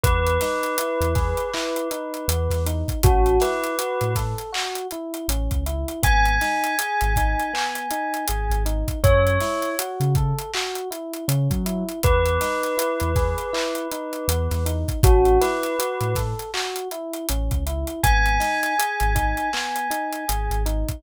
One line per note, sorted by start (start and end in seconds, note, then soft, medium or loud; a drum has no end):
0.03 0.38 E2 medium
0.03 0.38 B3 medium
0.03 2.64 B4 loud
0.03 kick loud
0.03 closed hi-hat loud
0.27 closed hi-hat medium
0.41 0.76 D#4 medium
0.41 snare medium
0.41 closed hi-hat medium
0.63 closed hi-hat medium
0.78 1.14 E4 medium
0.78 closed hi-hat loud
1.01 1.34 E2 medium
1.01 closed hi-hat medium
1.15 1.50 G#4 medium
1.15 kick medium
1.15 snare soft
1.15 closed hi-hat medium
1.37 closed hi-hat medium
1.53 1.88 E4 loud
1.53 clap loud
1.76 closed hi-hat medium
1.91 2.26 D#4 medium
1.91 closed hi-hat medium
2.14 closed hi-hat medium
2.28 2.48 E2 medium
2.28 2.63 B3 medium
2.28 closed hi-hat loud
2.50 2.83 E2 medium
2.50 snare soft
2.50 closed hi-hat medium
2.66 3.01 D#4 medium
2.66 closed hi-hat medium
2.88 kick medium
2.88 closed hi-hat medium
3.03 3.38 A1 medium
3.03 3.38 C#4 loud
3.03 3.37 F#4 medium
3.03 kick loud
3.03 closed hi-hat loud
3.26 closed hi-hat medium
3.40 3.75 E4 medium
3.40 4.15 B4 medium
3.40 snare medium
3.40 closed hi-hat medium
3.64 closed hi-hat medium
3.78 4.13 F#4 medium
3.78 closed hi-hat loud
4.01 4.34 A2 medium
4.01 closed hi-hat medium
4.15 4.51 A4 medium
4.15 kick medium
4.15 snare soft
4.15 closed hi-hat medium
4.38 closed hi-hat medium
4.53 4.87 F#4 medium
4.53 clap loud
4.75 closed hi-hat medium
4.91 5.27 E4 medium
4.91 closed hi-hat medium
5.14 closed hi-hat medium
5.28 5.48 A1 medium
5.28 5.64 C#4 medium
5.28 closed hi-hat loud
5.51 5.84 C#2 medium
5.51 kick medium
5.51 closed hi-hat medium
5.66 6.01 E4 medium
5.66 closed hi-hat medium
5.88 closed hi-hat medium
6.03 6.38 G#1 medium
6.03 6.37 B3 loud
6.03 8.56 G#5 loud
6.03 kick loud
6.03 closed hi-hat loud
6.25 closed hi-hat medium
6.41 6.76 D#4 medium
6.41 snare medium
6.41 closed hi-hat medium
6.64 closed hi-hat medium
6.79 7.13 G#4 medium
6.79 closed hi-hat loud
7.01 7.35 G#1 medium
7.01 closed hi-hat medium
7.16 7.52 D#4 medium
7.16 kick medium
7.16 closed hi-hat medium
7.40 closed hi-hat medium
7.53 7.88 B3 medium
7.53 clap loud
7.75 closed hi-hat medium
7.91 8.25 D#4 medium
7.91 closed hi-hat medium
8.14 closed hi-hat medium
8.28 8.49 G#1 medium
8.28 8.63 G#4 medium
8.28 closed hi-hat loud
8.50 8.83 G#1 medium
8.50 closed hi-hat medium
8.65 9.00 D#4 medium
8.65 closed hi-hat medium
8.88 kick medium
8.88 closed hi-hat medium
9.03 9.38 F#2 medium
9.03 9.38 C#4 loud
9.03 9.69 C#5 loud
9.03 kick loud
9.03 closed hi-hat medium
9.27 closed hi-hat medium
9.40 9.75 E4 medium
9.40 snare medium
9.40 closed hi-hat medium
9.62 closed hi-hat medium
9.79 10.13 F#4 medium
9.79 closed hi-hat loud
10.00 10.33 C#3 medium
10.00 closed hi-hat medium
10.15 10.51 A4 medium
10.15 kick medium
10.15 closed hi-hat medium
10.38 closed hi-hat medium
10.53 10.89 F#4 medium
10.53 clap loud
10.75 closed hi-hat medium
10.91 11.25 E4 medium
10.91 closed hi-hat medium
11.13 closed hi-hat medium
11.28 11.48 C#3 medium
11.28 11.62 C#4 medium
11.28 closed hi-hat loud
11.50 11.83 F#3 medium
11.50 kick medium
11.50 closed hi-hat medium
11.66 12.00 E4 medium
11.66 closed hi-hat medium
11.89 closed hi-hat medium
12.03 12.38 E2 medium
12.03 12.38 B3 medium
12.03 14.65 B4 loud
12.03 kick loud
12.03 closed hi-hat loud
12.25 closed hi-hat medium
12.41 12.75 D#4 medium
12.41 snare medium
12.41 closed hi-hat medium
12.63 closed hi-hat medium
12.77 13.12 E4 medium
12.77 closed hi-hat loud
13.00 13.34 E2 medium
13.00 closed hi-hat medium
13.16 13.50 G#4 medium
13.16 kick medium
13.16 snare soft
13.16 closed hi-hat medium
13.38 closed hi-hat medium
13.53 13.88 E4 loud
13.53 clap loud
13.75 closed hi-hat medium
13.91 14.26 D#4 medium
13.91 closed hi-hat medium
14.13 closed hi-hat medium
14.28 14.48 E2 medium
14.28 14.63 B3 medium
14.28 closed hi-hat loud
14.51 14.84 E2 medium
14.51 snare soft
14.51 closed hi-hat medium
14.66 15.00 D#4 medium
14.66 closed hi-hat medium
14.88 kick medium
14.88 closed hi-hat medium
15.03 15.38 A1 medium
15.03 15.38 C#4 loud
15.03 15.37 F#4 medium
15.03 kick loud
15.03 closed hi-hat loud
15.25 closed hi-hat medium
15.41 15.76 E4 medium
15.41 16.15 B4 medium
15.41 snare medium
15.41 closed hi-hat medium
15.63 closed hi-hat medium
15.79 16.13 F#4 medium
15.79 closed hi-hat loud
16.01 16.34 A2 medium
16.01 closed hi-hat medium
16.15 16.51 A4 medium
16.15 kick medium
16.15 snare soft
16.15 closed hi-hat medium
16.39 closed hi-hat medium
16.54 16.88 F#4 medium
16.54 clap loud
16.76 closed hi-hat medium
16.91 17.26 E4 medium
16.91 closed hi-hat medium
17.13 closed hi-hat medium
17.29 17.49 A1 medium
17.29 17.64 C#4 medium
17.29 closed hi-hat loud
17.51 17.84 C#2 medium
17.51 kick medium
17.51 closed hi-hat medium
17.66 18.01 E4 medium
17.66 closed hi-hat medium
17.87 closed hi-hat medium
18.03 18.39 G#1 medium
18.03 18.38 B3 loud
18.03 20.55 G#5 loud
18.03 kick loud
18.03 closed hi-hat loud
18.26 closed hi-hat medium
18.40 18.74 D#4 medium
18.40 snare medium
18.40 closed hi-hat medium
18.63 closed hi-hat medium
18.79 19.13 G#4 medium
18.79 closed hi-hat loud
19.00 19.34 G#1 medium
19.00 closed hi-hat medium
19.15 19.50 D#4 medium
19.15 kick medium
19.15 closed hi-hat medium
19.37 closed hi-hat medium
19.53 19.88 B3 medium
19.53 clap loud
19.76 closed hi-hat medium
19.90 20.25 D#4 medium
19.90 closed hi-hat medium
20.12 closed hi-hat medium
20.28 20.49 G#1 medium
20.28 20.63 G#4 medium
20.28 closed hi-hat loud
20.50 20.84 G#1 medium
20.50 closed hi-hat medium
20.66 21.00 D#4 medium
20.66 closed hi-hat medium
20.88 kick medium
20.88 closed hi-hat medium